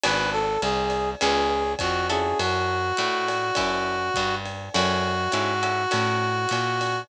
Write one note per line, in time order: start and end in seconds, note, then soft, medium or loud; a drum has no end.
0.03 0.58 G#1 medium
0.03 0.45 B3 medium
0.03 0.45 D4 medium
0.03 0.45 F#4 medium
0.03 0.45 G#4 medium
0.03 0.30 B4 loud
0.03 ride loud
0.32 0.60 A4 loud
0.62 1.15 C2 medium
0.62 1.10 G#4 loud
0.62 hi-hat pedal medium
0.62 ride medium
0.90 ride medium
1.20 1.75 C#2 medium
1.20 1.63 B3 medium
1.20 1.63 C#4 medium
1.20 1.63 F4 medium
1.20 1.72 G#4 loud
1.20 1.63 G#4 medium
1.20 ride medium
1.79 2.34 F2 medium
1.79 2.07 F#4 loud
1.79 kick medium
1.79 hi-hat pedal medium
1.79 ride medium
2.09 2.80 C#4 medium
2.09 2.80 E4 medium
2.09 2.80 F#4 medium
2.09 2.38 G#4 loud
2.09 2.80 A4 medium
2.09 ride medium
2.39 2.92 F#2 medium
2.39 4.35 F#4 loud
2.39 ride medium
2.97 3.51 A2 medium
2.97 hi-hat pedal medium
2.97 ride medium
3.28 ride medium
3.55 4.10 F#2 medium
3.55 3.98 C#4 medium
3.55 3.98 E4 medium
3.55 3.98 F#4 medium
3.55 3.98 A4 medium
3.55 kick medium
3.55 ride medium
4.14 4.69 G2 medium
4.14 kick soft
4.14 hi-hat pedal medium
4.14 ride medium
4.45 ride medium
4.74 5.28 F#2 medium
4.74 5.15 C#4 medium
4.74 5.15 E4 medium
4.74 7.01 F#4 loud
4.74 5.15 F#4 medium
4.74 5.15 A4 medium
4.74 ride medium
5.32 5.86 G#2 medium
5.32 5.54 C#4 medium
5.32 5.54 E4 medium
5.32 5.54 F#4 medium
5.32 5.54 A4 medium
5.32 hi-hat pedal medium
5.32 ride medium
5.63 5.83 C#4 medium
5.63 5.83 E4 medium
5.63 5.83 F#4 medium
5.63 5.83 A4 medium
5.63 ride medium
5.91 6.46 A2 medium
5.91 6.32 C#4 medium
5.91 6.32 E4 medium
5.91 6.32 F#4 medium
5.91 6.32 A4 medium
5.91 ride medium
6.49 7.04 A#2 medium
6.49 hi-hat pedal medium
6.49 ride medium
6.81 ride medium